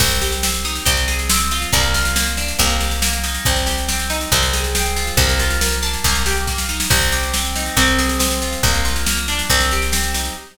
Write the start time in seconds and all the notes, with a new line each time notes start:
0.00 C2 C4, kick, snare, crash
0.11 snare
0.21 G4, snare
0.32 snare
0.43 C4, snare
0.54 snare
0.65 D#4, snare
0.75 snare
0.85 C2 C4, kick, snare
0.97 snare
1.08 G#4, snare
1.19 snare
1.29 C4, snare
1.40 snare
1.51 F4, snare
1.62 snare
1.72 C2 A#3, kick, snare
1.83 snare
1.94 F4, snare
2.05 snare
2.16 A#3, snare
2.27 snare
2.37 D4, snare
2.48 snare
2.59 C2 A#3, kick, snare
2.70 snare
2.81 G4, snare
2.91 snare
3.02 A#3, snare
3.13 snare
3.24 D#4, snare
3.35 snare
3.45 C2 C4, kick, snare
3.56 snare
3.66 G4, snare
3.78 snare
3.88 C4, snare
3.99 snare
4.10 D#4, snare
4.21 snare
4.32 C2 C4, kick, snare
4.43 snare
4.53 G#4, snare
4.64 snare
4.75 C4, snare
4.86 snare
4.96 F4, snare
5.07 snare
5.17 C2 A#3, kick, snare
5.29 snare
5.39 F4, snare
5.50 snare
5.61 A#3, snare
5.72 snare
5.82 D4, snare
5.94 snare
6.04 C2 A#3, kick, snare
6.15 snare
6.26 G4, snare
6.37 snare
6.47 A#3, kick, snare
6.58 snare
6.69 D#4, snare
6.80 snare
6.90 C2 C4, kick, snare, crash
7.01 snare
7.12 G4, snare
7.23 snare
7.33 C4, snare
7.45 snare
7.55 D#4, snare
7.66 snare
7.77 C2 C4, kick, snare
7.88 snare
7.99 G#4, snare
8.09 snare
8.19 C4, snare
8.31 snare
8.42 F4, snare
8.53 snare
8.63 C2 A#3, kick, snare
8.74 snare
8.85 F4, snare
8.96 snare
9.06 A#3, snare
9.17 snare
9.28 D4, snare
9.39 snare
9.50 C2 C4, kick, snare
9.60 snare
9.71 G4, snare
9.82 snare
9.92 C4, snare
10.04 snare
10.14 D#4, snare
10.25 snare